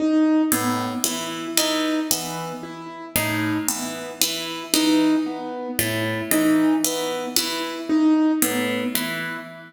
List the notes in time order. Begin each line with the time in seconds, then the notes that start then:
0.00 D#4
0.52 A2 B3
1.04 E3 E4
1.57 E3 D#4
2.11 E3 B3
2.63 E4
3.16 A2 D#4
3.68 E3 B3
4.21 E3 E4
4.73 E3 D#4
5.26 B3
5.79 A2 E4
6.31 E3 D#4
6.84 E3 B3
7.36 E3 E4
7.89 D#4
8.42 A2 B3
8.95 E3 E4